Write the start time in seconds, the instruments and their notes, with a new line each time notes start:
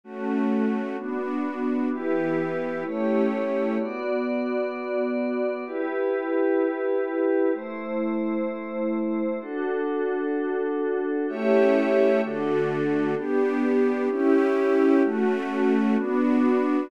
0.04 string ensemble 1 A3 C#4 F#4, pad 5 (bowed) A3 C#4 F#4
0.97 string ensemble 1 B3 D4 F#4, pad 5 (bowed) B3 D4 F#4
1.91 string ensemble 1 E3 B3 G4, pad 5 (bowed) E4 G4 B4
2.84 pad 5 (bowed) A3 E4 G4 C#5, string ensemble 1 A3 C#4 E4 G4
3.79 pad 5 (bowed) B3 F#4 D5
5.66 pad 5 (bowed) E4 G4 B4
7.54 pad 5 (bowed) A3 E4 C5
9.41 pad 5 (bowed) D4 F#4 A4
11.28 pad 5 (bowed) A3 G4 C#5 E5, string ensemble 1 A3 C#4 E4 G4
12.22 string ensemble 1 D3 A3 F#4, pad 5 (bowed) D4 F#4 A4
13.16 string ensemble 1 B3 D4 G4, pad 5 (bowed) B3 D4 G4
14.10 string ensemble 1 C#4 E4 G4, pad 5 (bowed) C#4 E4 G4
15.03 pad 5 (bowed) A3 C#4 F#4, string ensemble 1 A3 C#4 F#4
15.97 string ensemble 1 B3 D4 F#4, pad 5 (bowed) B3 D4 F#4